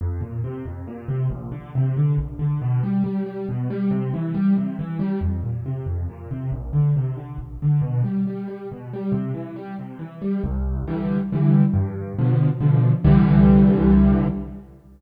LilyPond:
\new Staff { \clef bass \time 3/4 \key f \major \tempo 4 = 138 f,8 bes,8 c8 f,8 bes,8 c8 | bes,,8 d8 c8 d8 bes,,8 d8 | b,8 g8 g8 g8 b,8 g8 | c8 e8 g8 c8 e8 g8 |
f,8 bes,8 c8 f,8 bes,8 c8 | bes,,8 d8 c8 d8 bes,,8 d8 | b,8 g8 g8 g8 b,8 g8 | c8 e8 g8 c8 e8 g8 |
\key c \major c,4 <d e g>4 <d e g>4 | g,4 <b, d f>4 <b, d f>4 | <c, d e g>2. | }